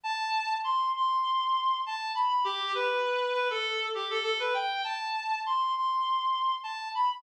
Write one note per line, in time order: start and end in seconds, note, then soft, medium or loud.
0.04 0.53 A5 loud
0.64 0.90 C6 loud
0.96 1.78 C6 loud
1.86 2.12 A5 loud
2.15 2.28 B5 medium
2.29 2.43 B5 medium
2.44 2.72 G4 loud
2.75 3.32 B4 medium
3.34 3.48 B4 loud
3.50 3.86 A4 loud
3.95 4.09 G4 medium
4.10 4.23 A4 medium
4.23 4.37 A4 loud
4.40 4.54 B4 medium
4.54 4.82 G5 loud
4.84 5.39 A5 loud
5.46 5.72 C6 medium
5.75 6.54 C6 medium
6.63 6.88 A5 medium
6.95 7.09 B5 medium
7.11 7.22 B5 loud